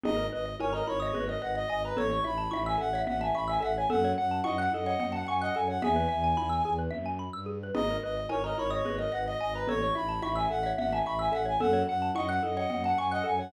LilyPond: <<
  \new Staff \with { instrumentName = "Clarinet" } { \time 7/8 \key gis \phrygian \tempo 4 = 109 dis''8 dis''8 cis''16 dis''16 cis''16 cis''8 dis''16 fis''16 dis''16 dis''16 b'16 | cis''16 cis'''16 b''8 b''16 gis''16 fis''8 fis''16 gis''16 b''16 gis''16 fis''16 gis''16 | fis''8 fis''8 dis''16 fis''16 dis''16 dis''8 fis''16 gis''16 dis''16 gis''16 fis''16 | gis''2 r4. |
dis''8 dis''8 cis''16 dis''16 cis''16 cis''8 dis''16 fis''16 dis''16 dis''16 b'16 | cis''16 cis'''16 b''8 b''16 gis''16 fis''8 fis''16 gis''16 b''16 gis''16 fis''16 gis''16 | fis''8 fis''8 dis''16 fis''16 dis''16 dis''8 fis''16 gis''16 dis''16 gis''16 fis''16 | }
  \new Staff \with { instrumentName = "Xylophone" } { \time 7/8 \key gis \phrygian dis'8 r8 ais'16 ais'8 dis''16 b'16 dis''16 dis''16 dis''16 dis''16 r16 | cis''8 r8 e''16 e''8 e''16 e''16 e''16 e''16 e''16 e''16 r16 | a'8 r8 fis''16 fis''8 fis''16 fis''16 fis''16 fis''16 fis''16 fis''16 r16 | e''4. r2 |
dis'8 r8 ais'16 ais'8 dis''16 b'16 dis''16 dis''16 dis''16 dis''16 r16 | cis''8 r8 e''16 e''8 e''16 e''16 e''16 e''16 e''16 e''16 r16 | a'8 r8 fis''16 fis''8 fis''16 fis''16 fis''16 fis''16 fis''16 fis''16 r16 | }
  \new Staff \with { instrumentName = "Xylophone" } { \time 7/8 \key gis \phrygian gis'16 ais'16 b'16 dis''16 gis''16 ais''16 b''16 dis'''16 gis'16 ais'16 b'16 dis''16 gis''16 ais''16 | a'16 cis''16 e''16 a''16 cis'''16 e'''16 a'16 cis''16 e''16 a''16 cis'''16 e'''16 a'16 cis''16 | a'16 cis''16 fis''16 a''16 cis'''16 fis'''16 a'16 cis''16 fis''16 a''16 cis'''16 fis'''16 a'16 cis''16 | gis'16 b'16 e''16 gis''16 b''16 e'''16 gis'16 b'16 e''16 gis''16 b''16 e'''16 gis'16 b'16 |
gis'16 ais'16 b'16 dis''16 gis''16 ais''16 b''16 dis'''16 gis'16 ais'16 b'16 dis''16 gis''16 ais''16 | a'16 cis''16 e''16 a''16 cis'''16 e'''16 a'16 cis''16 e''16 a''16 cis'''16 e'''16 a'16 cis''16 | a'16 cis''16 fis''16 a''16 cis'''16 fis'''16 a'16 cis''16 fis''16 a''16 cis'''16 fis'''16 a'16 cis''16 | }
  \new Staff \with { instrumentName = "Violin" } { \clef bass \time 7/8 \key gis \phrygian gis,,8 gis,,8 gis,,8 gis,,8 gis,,8 gis,,8 gis,,8 | a,,8 a,,8 a,,8 a,,8 a,,8 a,,8 a,,8 | fis,8 fis,8 fis,8 fis,8 fis,8 fis,8 fis,8 | e,8 e,8 e,8 e,8 fis,8. g,8. |
gis,,8 gis,,8 gis,,8 gis,,8 gis,,8 gis,,8 gis,,8 | a,,8 a,,8 a,,8 a,,8 a,,8 a,,8 a,,8 | fis,8 fis,8 fis,8 fis,8 fis,8 fis,8 fis,8 | }
  \new DrumStaff \with { instrumentName = "Drums" } \drummode { \time 7/8 cgl4 cgho8 cgho8 cgl4. | cgl8 cgho8 cgho4 cgl4. | cgl4 cgho8 cgho8 cgl4. | cgl4 cgho4 cgl4. |
cgl4 cgho8 cgho8 cgl4. | cgl8 cgho8 cgho4 cgl4. | cgl4 cgho8 cgho8 cgl4. | }
>>